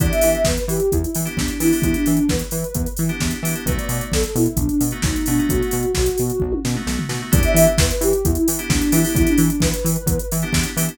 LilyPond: <<
  \new Staff \with { instrumentName = "Ocarina" } { \time 4/4 \key e \minor \tempo 4 = 131 d''16 e''16 e''8 b'16 b'16 g'8 e'16 e'16 r8 d'8 e'8 | e'16 d'8 d'16 b'4. r4. | b'16 d''16 d''8 a'16 a'16 e'8 d'16 d'16 r8 dis'8 d'8 | fis'2~ fis'8 r4. |
d''16 e''16 e''8 b'16 b'16 g'8 e'16 e'16 r8 d'8 e'8 | e'16 d'8 d'16 b'4. r4. | }
  \new Staff \with { instrumentName = "Electric Piano 2" } { \time 4/4 \key e \minor <b d' e' g'>2~ <b d' e' g'>8. <b d' e' g'>8. <b d' e' g'>16 <b d' e' g'>16~ | <b d' e' g'>2~ <b d' e' g'>8. <b d' e' g'>8. <b d' e' g'>16 <b d' e' g'>16 | <a b dis' fis'>2~ <a b dis' fis'>8. <a b dis' fis'>8. <a b dis' fis'>16 <a b dis' fis'>16~ | <a b dis' fis'>2~ <a b dis' fis'>8. <a b dis' fis'>8. <a b dis' fis'>16 <a b dis' fis'>16 |
<b d' e' g'>2~ <b d' e' g'>8. <b d' e' g'>8. <b d' e' g'>16 <b d' e' g'>16~ | <b d' e' g'>2~ <b d' e' g'>8. <b d' e' g'>8. <b d' e' g'>16 <b d' e' g'>16 | }
  \new Staff \with { instrumentName = "Synth Bass 1" } { \clef bass \time 4/4 \key e \minor e,8 e8 e,8 e8 e,8 e8 e,8 e8 | e,8 e8 e,8 e8 e,8 e8 e,8 e8 | b,,8 b,8 b,,8 b,8 b,,8 b,8 b,,8 b,8 | b,,8 b,8 b,,8 b,8 b,,8 b,8 b,,8 b,8 |
e,8 e8 e,8 e8 e,8 e8 e,8 e8 | e,8 e8 e,8 e8 e,8 e8 e,8 e8 | }
  \new DrumStaff \with { instrumentName = "Drums" } \drummode { \time 4/4 <hh bd>16 hh16 hho16 hh16 <bd sn>16 hh16 hho16 hh16 <hh bd>16 hh16 hho16 hh16 <bd sn>16 hh16 hho16 hho16 | <hh bd>16 hh16 hho16 hh16 <bd sn>16 hh16 hho16 hh16 <hh bd>16 hh16 hho16 hh16 <bd sn>16 hh16 hho16 hh16 | <hh bd>16 hh16 hho16 hh16 <bd sn>16 hh16 hho16 hh16 <hh bd>16 hh16 hho16 hh16 <bd sn>16 hh16 hho16 hh16 | <hh bd>16 hh16 hho16 hh16 <bd sn>16 hh16 hho16 hh16 bd16 tommh16 sn16 toml16 sn16 tomfh16 sn8 |
<hh bd>16 hh16 hho16 hh16 <bd sn>16 hh16 hho16 hh16 <hh bd>16 hh16 hho16 hh16 <bd sn>16 hh16 hho16 hho16 | <hh bd>16 hh16 hho16 hh16 <bd sn>16 hh16 hho16 hh16 <hh bd>16 hh16 hho16 hh16 <bd sn>16 hh16 hho16 hh16 | }
>>